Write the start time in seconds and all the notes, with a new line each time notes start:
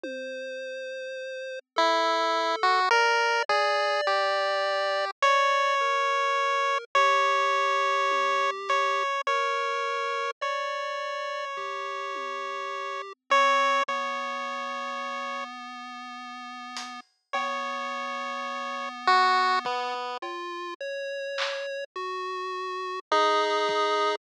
0.04 C5, high tom
1.76 E4 A4, floor tom
2.63 F#4
2.91 A#4 D5
3.49 G#4 D5, kick
4.07 G4
5.22 C#5 D5, closed hi-hat
5.81 A#4
6.95 G4 C#5
8.11 high tom
8.69 C#5, closed hi-hat
9.27 A#4 C#5
10.42 C#5 D5
11.57 G4, floor tom
12.15 high tom
13.30 C4 C#5
13.88 B3 C#5, kick
16.77 closed hi-hat
17.33 B3 C#5, cowbell
19.07 F#4
19.65 B3, kick
20.22 F4, cowbell
20.81 C#5
21.38 clap
21.96 F#4
23.12 D#4 G#4
23.69 kick